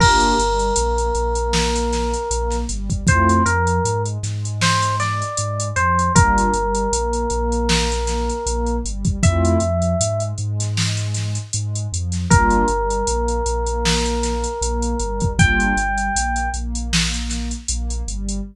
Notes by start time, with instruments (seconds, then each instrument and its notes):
0.00 synth bass 2 G1, pad 2 (warm) A#3 D4 F4 G4, electric piano 1 A#4, kick, crash
0.20 closed hi-hat
0.38 synth bass 2 G1, pad 2 (warm) G3, closed hi-hat
0.59 closed hi-hat
0.76 synth bass 2 A#1, pad 2 (warm) A#3, closed hi-hat
0.98 closed hi-hat
1.15 synth bass 2 A#1, pad 2 (warm) A#3, closed hi-hat
1.35 closed hi-hat
1.53 snare
1.76 closed hi-hat
1.93 snare, closed hi-hat
2.14 closed hi-hat
2.31 synth bass 2 A#1, pad 2 (warm) A#3, closed hi-hat
2.50 snare, closed hi-hat
2.69 synth bass 2 G1, pad 2 (warm) G3, closed hi-hat
2.90 kick, closed hi-hat
3.07 synth bass 2 F2, pad 2 (warm) A3 C4 E4 F4, electric piano 1 C5, kick, closed hi-hat
3.29 closed hi-hat
3.46 synth bass 2 F2, pad 2 (warm) F3, electric piano 1 A#4, closed hi-hat
3.67 closed hi-hat
3.85 synth bass 2 G#2, pad 2 (warm) G#3, closed hi-hat
4.05 closed hi-hat
4.23 synth bass 2 G#2, pad 2 (warm) G#3, snare, closed hi-hat
4.45 closed hi-hat
4.61 electric piano 1 C5, snare
4.82 closed hi-hat
5.00 electric piano 1 D5, snare, closed hi-hat
5.22 closed hi-hat
5.37 synth bass 2 G#2, pad 2 (warm) G#3, closed hi-hat
5.60 closed hi-hat
5.76 synth bass 2 F2, pad 2 (warm) F3, electric piano 1 C5, closed hi-hat
5.99 closed hi-hat
6.15 synth bass 2 G1, pad 2 (warm) G3 A#3 D4 F4, electric piano 1 A#4, kick, closed hi-hat
6.38 closed hi-hat
6.54 synth bass 2 G1, pad 2 (warm) G3, closed hi-hat
6.75 closed hi-hat
6.92 synth bass 2 A#1, pad 2 (warm) A#3, closed hi-hat
7.13 closed hi-hat
7.30 synth bass 2 A#1, pad 2 (warm) A#3, closed hi-hat
7.52 closed hi-hat
7.69 snare
7.92 closed hi-hat
8.07 snare, closed hi-hat
8.29 closed hi-hat
8.46 synth bass 2 A#1, pad 2 (warm) A#3, closed hi-hat
8.67 closed hi-hat
8.85 synth bass 2 G1, pad 2 (warm) G3, closed hi-hat
9.05 kick, closed hi-hat
9.23 synth bass 2 F2, pad 2 (warm) A3 C4 E4 F4, electric piano 1 E5, kick, closed hi-hat
9.45 closed hi-hat
9.60 synth bass 2 F2, pad 2 (warm) F3, closed hi-hat
9.82 closed hi-hat
10.00 synth bass 2 G#2, pad 2 (warm) G#3, closed hi-hat
10.20 closed hi-hat
10.38 synth bass 2 G#2, pad 2 (warm) G#3, closed hi-hat
10.60 snare, closed hi-hat
10.77 snare
10.97 closed hi-hat
11.14 snare, closed hi-hat
11.35 closed hi-hat
11.53 synth bass 2 G#2, pad 2 (warm) G#3, closed hi-hat
11.75 closed hi-hat
11.92 synth bass 2 F2, pad 2 (warm) F3, closed hi-hat
12.12 snare, closed hi-hat
12.30 synth bass 2 G1, pad 2 (warm) G3 A#3 D4 F4, electric piano 1 A#4, kick, closed hi-hat
12.50 closed hi-hat
12.68 synth bass 2 G1, pad 2 (warm) G3, closed hi-hat
12.90 closed hi-hat
13.07 synth bass 2 A#1, pad 2 (warm) A#3, closed hi-hat
13.28 closed hi-hat
13.46 synth bass 2 A#1, pad 2 (warm) A#3, closed hi-hat
13.67 closed hi-hat
13.85 snare
14.05 closed hi-hat
14.23 snare, closed hi-hat
14.44 closed hi-hat
14.61 synth bass 2 A#1, pad 2 (warm) A#3, closed hi-hat
14.82 closed hi-hat
15.00 synth bass 2 G1, pad 2 (warm) G3, closed hi-hat
15.20 kick, closed hi-hat
15.38 synth bass 2 G1, pad 2 (warm) G3 A#3 D4 F4, electric piano 1 G5, kick, closed hi-hat
15.60 closed hi-hat
15.77 synth bass 2 G1, pad 2 (warm) G3, closed hi-hat
15.98 closed hi-hat
16.15 synth bass 2 A#1, pad 2 (warm) A#3, closed hi-hat
16.36 closed hi-hat
16.54 synth bass 2 A#1, pad 2 (warm) A#3, closed hi-hat
16.75 closed hi-hat
16.93 snare
17.14 closed hi-hat
17.30 snare, closed hi-hat
17.51 closed hi-hat
17.68 synth bass 2 A#1, pad 2 (warm) A#3, closed hi-hat
17.90 closed hi-hat
18.08 synth bass 2 G1, pad 2 (warm) G3, closed hi-hat
18.29 closed hi-hat